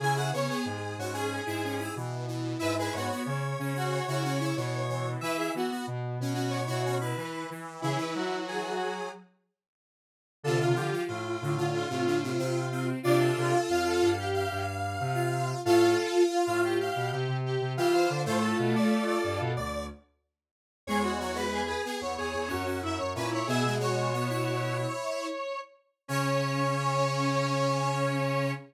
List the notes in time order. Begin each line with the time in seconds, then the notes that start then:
0.00 C#3 E4 G#4 G#5
0.15 E4 G#4 F#5
0.33 C#3 B3 C#5
0.49 B3 G#4
0.65 G#2
0.98 G#2 C#4 F#4
1.13 C#4 G#4
1.46 G#2 E4 G#4
1.64 C#4
1.79 E4
1.96 B2 E3
2.27 E3
2.59 G#2 E4 B4 E5
2.78 E4 G#4 B4
2.93 G#2 B3 F#4 C#5
3.11 B3
3.26 C#3 C#5
3.59 C#3 C#4
3.74 C#4 F#4
3.92 C#5
4.07 C#3 E4 F#4
4.24 C#4
4.40 E4
4.56 B2 E3
4.89 E3
5.21 E3 E4 B4 E5
5.36 E4 G#4
5.54 E3 B3 F#4
5.71 B3
5.87 B2
6.20 B2 C#4
6.34 C#4 F#4
6.50 C#5
6.66 B2 E4 F#4
6.85 C#4
7.00 E4 B4
7.17 E3
7.50 E3
7.82 C#3 E3 E4 G#4
7.97 E3 B4
8.15 F#3 F#4
8.48 G#4
10.43 C3 D3 F4 A4
10.59 C3 F4
10.75 D3 F3 F4 G4
10.93 F3
11.08 A2 F4
11.41 A2 D3
11.57 D3 F4
11.74 F4
11.89 A2 C3 F4
12.06 D3
12.23 C3
12.38 C3 C4
12.72 C4
13.03 C3 D4 F4 D5
13.21 A4
13.37 C3 A4
13.69 F2 F4 F5
13.87 A4
14.02 G2
14.18 G4
14.34 F5
14.51 G2
15.00 C3
15.14 F4
15.65 A2 F4 A4 F5
16.30 F4
16.46 A2 F4 F5
16.63 G4
16.81 F5
16.96 B2
17.11 C3 G4
17.28 C3
17.45 G4
17.61 C3
17.77 E3 F4 G4 F5
17.93 C5 F5
18.10 D3
18.25 A2 A3 F4 A4 C5
18.42 A4
18.59 B2
18.76 D5
19.07 D5
19.24 G2
19.40 B2
19.57 D2 D5
20.87 E2 G#3 G#4 C#5
21.03 F#4
21.20 F#3 C#5
21.34 G#3 B4
21.53 G#4
21.67 G#4 B4
21.85 B3 G#4
22.01 E2 C#5
22.17 E2 G#4
22.34 E2
22.48 F#2 C#4 F#4
22.66 C#4
22.83 F#2 E4 E5
22.98 F#2 C#5
23.15 A#2 C#4 E4 B4
23.31 E4 C#5
23.47 B2 B3 G#4 E5
23.64 B2 G#3
23.79 G#3 F#4 C#5
24.13 B3
24.29 E4
26.08 C#3 C#4 C#5